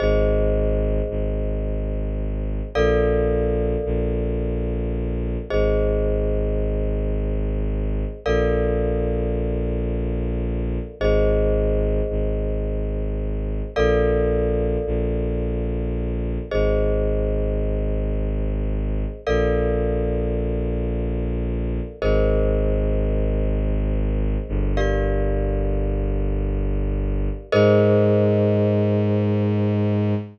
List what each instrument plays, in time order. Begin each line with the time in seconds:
0.00 violin G#1, glockenspiel G#4 C5 D#5
1.10 violin G#1
2.75 violin A#1, glockenspiel A4 A#4 D5 F5
3.85 violin A#1
5.50 violin G#1, glockenspiel G#4 C5 D#5
8.25 violin A#1, glockenspiel A4 A#4 D5 F5
11.00 violin G#1, glockenspiel G#4 C5 D#5
12.10 violin G#1
13.76 violin A#1, glockenspiel A4 A#4 D5 F5
14.86 violin A#1
16.51 violin G#1, glockenspiel G#4 C5 D#5
19.27 violin A#1, glockenspiel A4 A#4 D5 F5
22.02 violin G#1, glockenspiel G#4 A#4 C5 D#5
24.48 violin G1
24.77 glockenspiel G4 A#4 D5 F5
27.52 violin G#2, glockenspiel G#4 A#4 C5 D#5